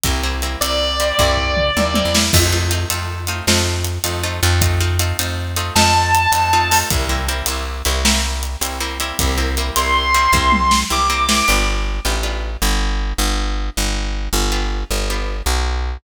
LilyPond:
<<
  \new Staff \with { instrumentName = "Distortion Guitar" } { \time 12/8 \key c \major \tempo 4. = 105 r4. d''1~ d''8 | r1. | r2. a''2. | r1. |
r4. c'''2. d'''4. | r1. | r1. | }
  \new Staff \with { instrumentName = "Acoustic Guitar (steel)" } { \time 12/8 \key c \major <g bes c' e'>8 <g bes c' e'>8 <g bes c' e'>8 <g bes c' e'>4 <g bes c' e'>8 <g bes c' e'>4. <g bes c' e'>8 <g bes c' e'>8 <g bes c' e'>8 | <a c' ees' f'>8 <a c' ees' f'>8 <a c' ees' f'>8 <a c' ees' f'>4 <a c' ees' f'>8 <a c' ees' f'>4. <a c' ees' f'>8 <a c' ees' f'>8 <a c' ees' f'>8 | <a c' ees' f'>8 <a c' ees' f'>8 <a c' ees' f'>8 <a c' ees' f'>4 <a c' ees' f'>8 <a c' ees' f'>4. <a c' ees' f'>8 <a c' ees' f'>8 <a c' ees' f'>8 | <g bes c' e'>8 <g bes c' e'>8 <g bes c' e'>8 <g bes c' e'>4 <g bes c' e'>8 <g bes c' e'>4. <g bes c' e'>8 <g bes c' e'>8 <g bes c' e'>8 |
<g bes c' e'>8 <g bes c' e'>8 <g bes c' e'>8 <g bes c' e'>4 <g bes c' e'>8 <g bes c' e'>4. <g bes c' e'>8 <g bes c' e'>8 <g bes c' e'>8 | <b d' f' g'>4. <b d' f' g'>8 <b d' f' g'>1~ | <b d' f' g'>2 <b d' f' g'>4. <b d' f' g'>2~ <b d' f' g'>8 | }
  \new Staff \with { instrumentName = "Electric Bass (finger)" } { \clef bass \time 12/8 \key c \major c,4. c,4. c,4. ees,8. e,8. | f,4. f,4. f,4. f,4 f,8~ | f,4. f,4. f,4. f,4. | c,4. c,4 c,2 c,4. |
c,4. c,4. c,4. c,4. | g,,4. a,,4. g,,4. g,,4. | g,,4. g,,4. g,,4. b,,4. | }
  \new DrumStaff \with { instrumentName = "Drums" } \drummode { \time 12/8 <hh bd>4 hh8 hh4 hh8 <bd tomfh>8 tomfh8 toml8 tommh8 tommh8 sn8 | <cymc bd>4 hh8 hh4 hh8 sn4 hh8 hh4 hh8 | <hh bd>4 hh8 hh4 hh8 sn4 hh8 hh4 hho8 | <hh bd>4 hh8 hh4 hh8 sn4 hh8 hh4 hh8 |
<hh bd>4 hh8 hh4 hh8 bd8 tommh8 sn8 r4 sn8 | r4. r4. r4. r4. | r4. r4. r4. r4. | }
>>